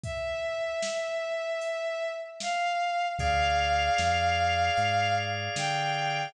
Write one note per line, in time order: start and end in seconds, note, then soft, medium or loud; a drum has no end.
0.03 2.08 E5 medium
0.03 kick medium
0.03 closed hi-hat medium
0.82 snare loud
1.61 closed hi-hat medium
2.40 3.06 F5 medium
2.40 snare medium
3.19 3.90 D2 medium
3.19 6.29 G#4 medium
3.19 6.29 D5 medium
3.19 6.29 F5 medium
3.19 5.13 F5 loud
3.19 kick medium
3.19 closed hi-hat medium
3.98 4.70 F2 medium
3.98 snare medium
4.77 5.49 G#2 medium
4.77 closed hi-hat medium
5.56 6.27 D3 medium
5.56 6.32 G5 medium
5.56 snare loud